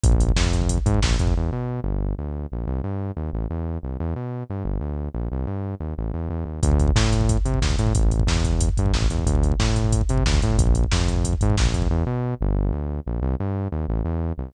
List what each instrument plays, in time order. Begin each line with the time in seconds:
0.04 synth bass 1 A#1, kick, closed hi-hat
0.12 kick
0.20 kick, closed hi-hat
0.29 kick
0.36 synth bass 1 F2, kick, snare
0.45 kick
0.53 kick, closed hi-hat
0.62 kick
0.69 kick, closed hi-hat
0.78 kick
0.86 synth bass 1 G#2, kick, closed hi-hat
0.94 kick
1.02 synth bass 1 A#1, kick, snare
1.11 kick
1.19 synth bass 1 F2, kick, closed hi-hat
1.27 kick
1.37 synth bass 1 E2
1.52 synth bass 1 B2
1.84 synth bass 1 G1
2.18 synth bass 1 D2
2.52 synth bass 1 A#1
2.67 synth bass 1 C2
2.84 synth bass 1 G2
3.17 synth bass 1 D#2
3.33 synth bass 1 A1
3.50 synth bass 1 E2
3.83 synth bass 1 C2
4.00 synth bass 1 E2
4.16 synth bass 1 B2
4.50 synth bass 1 G2
4.65 synth bass 1 G1
4.81 synth bass 1 D2
5.14 synth bass 1 A#1
5.32 synth bass 1 C2
5.47 synth bass 1 G2
5.80 synth bass 1 D#2
5.98 synth bass 1 A1
6.14 synth bass 1 E2
6.29 synth bass 1 E2
6.46 synth bass 1 D#2
6.63 synth bass 1 D2, kick, closed hi-hat
6.71 kick
6.79 kick, closed hi-hat
6.88 kick
6.95 synth bass 1 A2, kick, snare
7.04 kick
7.12 kick, closed hi-hat
7.21 kick
7.29 kick, closed hi-hat
7.37 kick
7.45 synth bass 1 C3, kick, closed hi-hat
7.54 kick
7.62 synth bass 1 D2, kick, snare
7.70 kick
7.79 synth bass 1 A2, kick, closed hi-hat
7.87 kick
7.95 synth bass 1 A1, kick, closed hi-hat
8.03 kick
8.11 kick, closed hi-hat
8.20 kick
8.27 synth bass 1 E2, kick, snare
8.36 kick
8.45 kick, closed hi-hat
8.53 kick
8.61 kick, closed hi-hat
8.69 kick
8.77 synth bass 1 G2, kick, closed hi-hat
8.86 kick
8.93 synth bass 1 A1, kick, snare
9.02 kick
9.10 synth bass 1 E2, kick, closed hi-hat
9.19 kick
9.26 synth bass 1 D2, kick, closed hi-hat
9.35 kick
9.43 kick, closed hi-hat
9.52 kick
9.60 synth bass 1 A2, kick, snare
9.68 kick
9.76 kick, closed hi-hat
9.84 kick
9.93 kick, closed hi-hat
10.01 kick
10.09 synth bass 1 C3, kick, closed hi-hat
10.18 kick
10.26 synth bass 1 D2, kick, snare
10.34 kick
10.42 synth bass 1 A2, kick, closed hi-hat
10.50 kick
10.57 synth bass 1 A#1, kick, closed hi-hat
10.67 kick
10.75 kick, closed hi-hat
10.84 kick
10.91 synth bass 1 F2, kick, snare
11.00 kick
11.08 kick, closed hi-hat
11.16 kick
11.24 kick, closed hi-hat
11.33 kick
11.41 synth bass 1 G#2, kick, closed hi-hat
11.50 kick
11.57 synth bass 1 A#1, kick, snare
11.65 kick
11.74 synth bass 1 F2, kick, closed hi-hat
11.82 kick
11.90 synth bass 1 E2
12.06 synth bass 1 B2
12.41 synth bass 1 G1
12.72 synth bass 1 D2
13.06 synth bass 1 A#1
13.22 synth bass 1 C2
13.40 synth bass 1 G2
13.72 synth bass 1 D#2
13.88 synth bass 1 A1
14.05 synth bass 1 E2
14.38 synth bass 1 C2